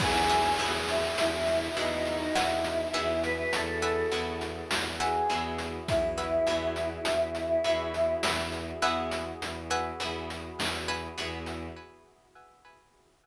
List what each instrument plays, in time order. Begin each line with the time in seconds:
0.00 violin E2, overdriven guitar B3 E4 F#4 G#4, pad 2 (warm) B3 E4 F#4 G#4, choir aahs G#4, pizzicato strings B4 E5 F#5 G#5, kick, crash
0.29 pizzicato strings B4 E5 F#5 G#5, closed hi-hat
0.59 violin E2, overdriven guitar B3 E4 F#4 G#4, closed hi-hat
0.88 choir aahs E4, closed hi-hat
1.18 violin E2, choir aahs E4, closed hi-hat
1.47 closed hi-hat
1.76 violin E2, overdriven guitar B3 E4 F#4 G#4, choir aahs D#4, closed hi-hat
2.05 closed hi-hat
2.35 violin E2, choir aahs E4, pizzicato strings B4 E5 F#5 G#5, snare
2.64 closed hi-hat
2.94 violin E2, overdriven guitar B3 E4 F#4 G#4, pizzicato strings B4 E5 F#5 G#5, closed hi-hat
3.23 choir aahs B4, closed hi-hat
3.53 violin E2, choir aahs A4, closed hi-hat
3.82 pizzicato strings B4 E5 F#5 G#5, closed hi-hat
4.12 violin E2, overdriven guitar B3 E4 F#4 G#4, closed hi-hat
4.41 closed hi-hat
4.71 violin E2, snare
5.00 choir aahs G#4, pizzicato strings B4 E5 F#5 G#5, closed hi-hat
5.29 violin E2, overdriven guitar B3 E4 F#4 G#4, closed hi-hat
5.58 closed hi-hat
5.88 violin E2, choir aahs E4, kick, closed hi-hat
6.17 pizzicato strings B4 E5 F#5 G#5, closed hi-hat
6.47 violin E2, overdriven guitar B3 E4 F#4 G#4, closed hi-hat
6.76 closed hi-hat
7.05 violin E2, closed hi-hat
7.35 closed hi-hat
7.64 violin E2, overdriven guitar B3 E4 F#4 G#4, closed hi-hat
7.94 closed hi-hat
8.23 violin E2, pizzicato strings B4 E5 F#5 G#5, snare
8.52 closed hi-hat
8.82 violin E2, overdriven guitar B3 E4 F#4 G#4, pizzicato strings B4 E5 F#5 G#5, closed hi-hat
9.12 closed hi-hat
9.41 violin E2, closed hi-hat
9.70 pizzicato strings B4 E5 F#5 G#5, closed hi-hat
10.00 violin E2, overdriven guitar B3 E4 F#4 G#4, closed hi-hat
10.30 closed hi-hat
10.58 violin E2, snare
10.88 pizzicato strings B4 E5 F#5 G#5, closed hi-hat
11.18 violin E2, overdriven guitar B3 E4 F#4 G#4, closed hi-hat
11.46 closed hi-hat